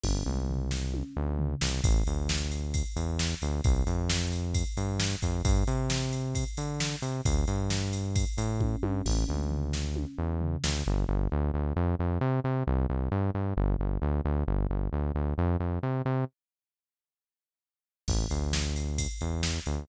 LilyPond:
<<
  \new Staff \with { instrumentName = "Synth Bass 1" } { \clef bass \time 4/4 \key g \dorian \tempo 4 = 133 g,,8 c,2 d,4 c,8 | \key a \dorian a,,8 d,2 e,4 d,8 | c,8 f,2 g,4 f,8 | g,8 c2 d4 c8 |
d,8 g,2 a,4 g,8 | a,,8 d,2 e,4 d,8 | \key g \dorian g,,8 g,,8 d,8 d,8 f,8 f,8 c8 c8 | c,8 c,8 g,8 g,8 g,,8 g,,8 d,8 d,8 |
g,,8 g,,8 d,8 d,8 f,8 f,8 c8 c8 | r1 | \key a \dorian a,,8 d,2 e,4 d,8 | }
  \new DrumStaff \with { instrumentName = "Drums" } \drummode { \time 4/4 <cymc bd tommh>8 toml8 tomfh8 sn8 tommh4 tomfh8 sn8 | <bd cymr>8 cymr8 sn8 cymr8 <bd cymr>8 cymr8 sn8 cymr8 | <bd cymr>8 cymr8 sn8 cymr8 <bd cymr>8 cymr8 sn8 <bd cymr>8 | <bd cymr>8 cymr8 sn8 cymr8 <bd cymr>8 cymr8 sn8 cymr8 |
<bd cymr>8 cymr8 sn8 cymr8 <bd cymr>8 cymr8 <bd tommh>8 tommh8 | <cymc bd tommh>8 toml8 tomfh8 sn8 tommh4 tomfh8 sn8 | r4 r4 r4 r4 | r4 r4 r4 r4 |
r4 r4 r4 r4 | r4 r4 r4 r4 | <cymc bd>8 cymr8 sn8 cymr8 <bd cymr>8 cymr8 sn8 cymr8 | }
>>